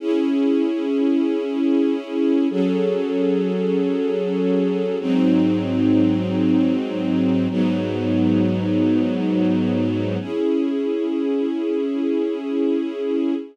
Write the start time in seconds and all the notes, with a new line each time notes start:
0.00 C#4 E4 G#4
2.50 F#3 C#4 G#4 A4
5.00 G#2 F#3 C4 D#4
7.50 G#2 F#3 B3 D#4
10.20 C#4 E4 G#4